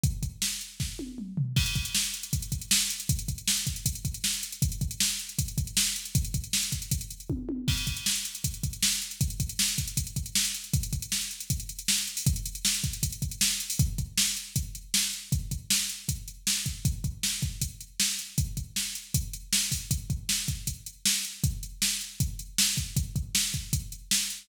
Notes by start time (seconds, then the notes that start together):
0.04 kick, closed hi-hat
0.23 kick, closed hi-hat
0.42 snare
0.61 closed hi-hat
0.80 kick, snare
0.99 high tom
1.18 mid tom
1.37 floor tom
1.56 kick, crash
1.66 closed hi-hat
1.75 kick, closed hi-hat
1.85 closed hi-hat
1.95 snare
2.04 closed hi-hat
2.14 closed hi-hat
2.23 closed hi-hat
2.33 kick, closed hi-hat
2.42 closed hi-hat
2.52 kick, closed hi-hat
2.61 closed hi-hat
2.71 snare
2.80 closed hi-hat
2.90 closed hi-hat
3.00 closed hi-hat
3.09 kick, closed hi-hat
3.19 closed hi-hat
3.28 kick, closed hi-hat
3.38 closed hi-hat
3.48 snare
3.57 closed hi-hat
3.67 kick, closed hi-hat
3.76 closed hi-hat
3.86 kick, closed hi-hat
3.95 closed hi-hat
4.05 kick, closed hi-hat
4.14 closed hi-hat
4.24 snare
4.33 closed hi-hat
4.43 closed hi-hat
4.52 closed hi-hat
4.62 kick, closed hi-hat
4.72 closed hi-hat
4.81 kick, closed hi-hat
4.91 closed hi-hat
5.00 snare
5.10 closed hi-hat
5.19 closed hi-hat
5.29 closed hi-hat
5.39 kick, closed hi-hat
5.48 closed hi-hat
5.58 kick, closed hi-hat
5.67 closed hi-hat
5.77 snare
5.86 closed hi-hat
5.96 closed hi-hat
6.05 closed hi-hat
6.15 kick, closed hi-hat
6.25 closed hi-hat
6.34 kick, closed hi-hat
6.44 closed hi-hat
6.53 snare
6.63 closed hi-hat
6.72 kick, closed hi-hat
6.82 closed hi-hat
6.91 kick, closed hi-hat
7.01 closed hi-hat
7.11 closed hi-hat
7.20 closed hi-hat
7.30 kick, high tom
7.49 high tom
7.68 kick, crash
7.77 closed hi-hat
7.87 kick, closed hi-hat
7.96 closed hi-hat
8.06 snare
8.16 closed hi-hat
8.25 closed hi-hat
8.35 closed hi-hat
8.44 kick, closed hi-hat
8.54 closed hi-hat
8.63 kick, closed hi-hat
8.73 closed hi-hat
8.82 snare
8.92 closed hi-hat
9.02 closed hi-hat
9.11 closed hi-hat
9.21 kick, closed hi-hat
9.30 closed hi-hat
9.40 kick, closed hi-hat
9.49 closed hi-hat
9.59 snare
9.68 closed hi-hat
9.78 kick, closed hi-hat
9.88 closed hi-hat
9.97 kick, closed hi-hat
10.07 closed hi-hat
10.16 kick, closed hi-hat
10.26 closed hi-hat
10.35 snare
10.45 closed hi-hat
10.54 closed hi-hat
10.64 closed hi-hat
10.73 kick, closed hi-hat
10.83 closed hi-hat
10.93 kick, closed hi-hat
11.02 closed hi-hat
11.12 snare
11.21 closed hi-hat
11.31 closed hi-hat
11.40 closed hi-hat
11.50 kick, closed hi-hat
11.60 closed hi-hat
11.69 closed hi-hat
11.79 closed hi-hat
11.88 snare
11.98 closed hi-hat
12.07 closed hi-hat
12.17 open hi-hat
12.26 kick, closed hi-hat
12.36 closed hi-hat
12.46 closed hi-hat
12.55 closed hi-hat
12.65 snare
12.74 closed hi-hat
12.84 kick, closed hi-hat
12.93 closed hi-hat
13.03 kick, closed hi-hat
13.12 closed hi-hat
13.22 kick, closed hi-hat
13.31 closed hi-hat
13.41 snare
13.51 closed hi-hat
13.60 closed hi-hat
13.70 open hi-hat
13.79 kick, closed hi-hat
13.98 kick, closed hi-hat
14.18 snare
14.37 closed hi-hat
14.56 kick, closed hi-hat
14.75 closed hi-hat
14.94 snare
15.13 closed hi-hat
15.32 kick, closed hi-hat
15.51 kick, closed hi-hat
15.70 snare
15.89 closed hi-hat
16.09 kick, closed hi-hat
16.28 closed hi-hat
16.47 snare
16.66 kick, closed hi-hat
16.85 kick, closed hi-hat
17.04 kick, closed hi-hat
17.23 snare
17.42 kick, closed hi-hat
17.61 kick, closed hi-hat
17.80 closed hi-hat
18.00 snare
18.19 closed hi-hat
18.38 kick, closed hi-hat
18.57 kick, closed hi-hat
18.76 snare
18.95 closed hi-hat
19.14 kick, closed hi-hat
19.33 closed hi-hat
19.53 snare
19.72 kick, open hi-hat
19.91 kick, closed hi-hat
20.10 kick, closed hi-hat
20.29 snare
20.48 kick, closed hi-hat
20.67 kick, closed hi-hat
20.86 closed hi-hat
21.05 snare
21.24 closed hi-hat
21.44 kick, closed hi-hat
21.63 closed hi-hat
21.82 snare
22.01 closed hi-hat
22.20 kick, closed hi-hat
22.39 closed hi-hat
22.58 snare
22.77 kick, closed hi-hat
22.96 kick, closed hi-hat
23.16 kick, closed hi-hat
23.35 snare
23.54 kick, closed hi-hat
23.73 kick, closed hi-hat
23.92 closed hi-hat
24.11 snare
24.30 closed hi-hat